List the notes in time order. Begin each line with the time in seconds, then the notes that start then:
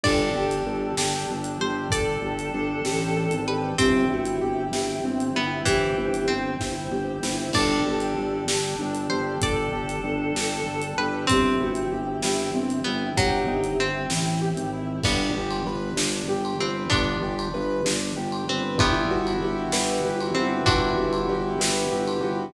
0.04 G1 D4 G4 A4 D5, kick, crash
0.35 G1 G4
0.51 closed hi-hat
0.66 G1 A4
0.97 G1 G4, snare
1.29 G1 D4
1.44 closed hi-hat
1.60 G1 G4 C5
1.90 G1 A4 D5, kick, closed hi-hat
2.22 G1 G4
2.39 closed hi-hat
2.54 G1 D4
2.85 A1 G4, snare
3.17 A4
3.30 G#1, closed hi-hat
3.48 G4 B4
3.78 G1 C4 E4 G4, kick, closed hi-hat
4.09 G1 E4 F#4
4.25 closed hi-hat
4.41 G1 G4
4.71 G1 E4 G4, snare
5.04 G1 C4
5.20 closed hi-hat
5.35 G1 B3 E4
5.65 G1 E3 C4 G4 C5, kick, closed hi-hat
5.98 G1 E4
6.14 closed hi-hat
6.28 G1 C4
6.60 G1 E4, kick, snare
6.91 G1 G4
7.23 G1 E4, snare
7.53 G1 D4 G4 A4 D5, kick, crash
7.85 G1 G4
8.00 closed hi-hat
8.17 G1 A4
8.47 G1 G4, snare
8.79 G1 D4
8.95 closed hi-hat
9.10 G1 G4 C5
9.40 G1 A4 D5, kick, closed hi-hat
9.72 G1 G4
9.89 closed hi-hat
10.04 G1 D4
10.35 G1 G4, snare
10.66 G1 A4
10.82 closed hi-hat
10.98 G1 G4 B4
11.27 G1 C4 E4 G4, kick, closed hi-hat
11.60 G1 E4 F#4
11.75 closed hi-hat
11.92 G1 G4
12.22 G1 E4 G4, snare
12.54 G1 C4
12.70 closed hi-hat
12.84 G1 B3 E4
13.17 G1 F#3 G4, kick, closed hi-hat
13.47 G1 D#4
13.64 closed hi-hat
13.79 G1 C4
14.10 A1 E4, snare
14.42 G4
14.57 G#1, closed hi-hat
14.73 E4
15.03 G1 G3 B3 D4, kick, crash
15.35 G1 G4
15.51 ride
15.65 G1 B4
15.96 G1 D4, snare
16.27 G1 G4
16.45 ride
16.59 G1 C4 B4
16.90 G1 B3 D4, kick, ride
17.21 G1 G4
17.39 ride
17.54 G1 B4
17.85 G1 D4, snare
18.17 G1 G4
18.32 ride
18.48 G1 C4 B4
18.78 G1 G3 B3 E4, kick, ride
19.10 G1 F#4
19.27 ride
19.41 G1 G4
19.72 G1 B4, snare
20.04 G1 G4
20.20 ride
20.35 G1 C4 F#4
20.66 G1 D4 E4 F#4, kick, ride
20.98 G1 F#4
21.13 ride
21.29 G1 G4
21.59 G1 B4, snare
21.92 G1 G4
22.07 ride
22.21 G1 F#4